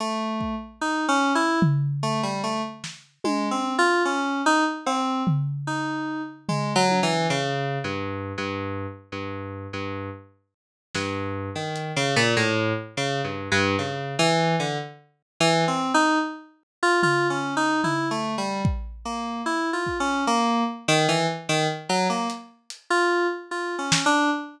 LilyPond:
<<
  \new Staff \with { instrumentName = "Electric Piano 2" } { \time 3/4 \tempo 4 = 74 a8. r16 \tuplet 3/2 { dis'8 cis'8 e'8 } r8 a16 g16 | a16 r8. \tuplet 3/2 { gis8 c'8 f'8 } cis'8 dis'16 r16 | c'8 r8 dis'8. r16 \tuplet 3/2 { gis8 fis8 e8 } | \tuplet 3/2 { cis4 g,4 g,4 } r16 g,8. |
g,8 r4 g,8. dis8 cis16 | ais,16 a,8 r16 \tuplet 3/2 { cis8 g,8 g,8 } cis8 e8 | d16 r8. \tuplet 3/2 { e8 c'8 dis'8 } r8. f'16 | \tuplet 3/2 { f'8 cis'8 dis'8 e'8 a8 g8 } r8 ais8 |
\tuplet 3/2 { e'8 f'8 cis'8 } ais8 r16 dis16 e16 r16 dis16 r16 | fis16 ais16 r8. f'8 r16 \tuplet 3/2 { f'8 cis'8 d'8 } | }
  \new DrumStaff \with { instrumentName = "Drums" } \drummode { \time 3/4 r8 bd8 r4 tomfh4 | r8 sn8 tommh4 r4 | cb8 tomfh8 r4 tomfh8 tommh8 | r4 r4 r4 |
r4 r8 sn8 r8 hh8 | r4 r4 r4 | r4 r4 r4 | tomfh4 tomfh4 bd4 |
r8 bd8 r4 r4 | r8 hh8 hh4 r8 sn8 | }
>>